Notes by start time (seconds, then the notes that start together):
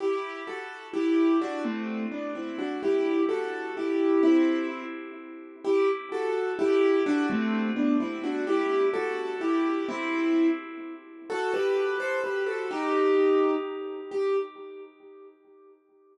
0.00 E4 G4
0.47 F#4 A4
0.93 E4 G4
1.41 D4 F#4
1.64 A3 C4
2.12 B3 D4
2.35 C4 E4
2.58 D4 F#4
2.83 E4 G4
3.29 F#4 A4
3.77 E4 G4
4.23 C4 E4
5.65 E4 G4
6.12 F#4 A4
6.59 E4 G4
7.06 D4 F#4
7.30 A3 C4
7.76 B3 D4
8.00 C4 E4
8.24 D4 F#4
8.47 E4 G4
8.94 F#4 A4
9.41 E4 G4
9.89 C4 E4
11.30 F#4 A4
11.54 G4 B4
12.00 A4 C5
12.24 G4 B4
12.46 F#4 A4
12.71 D#4 G4
14.11 G4